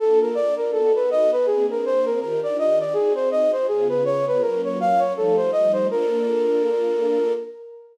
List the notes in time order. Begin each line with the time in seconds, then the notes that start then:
0.00 A#3 D4 F4 A4
0.21 A#4
0.35 D5
0.57 A#4
0.73 B3 D#4 F#4 A4
0.95 B4
1.11 D#5
1.32 B4
1.46 A#3 C4 D4 G#4
1.71 A#4
1.86 C5
2.05 A#4
2.20 D#3 D4 F4 G4 A#4
2.43 D5
2.59 D#5
2.80 D5
2.93 C4 D#4 F#4 G#4
3.15 C5
3.31 D#5
3.52 C5
3.68 C#3 B3 F4 G#4
3.89 B4
4.05 C#5
4.27 B4
4.41 F#3 A#3 C#4 F4 A#4
4.64 C#5
4.80 F5
4.99 C#5
5.15 F3 G3 A3 D#4 A4
5.37 C5
5.52 D#5
5.73 C5
5.89 A#3 D4 F4 A4 A#4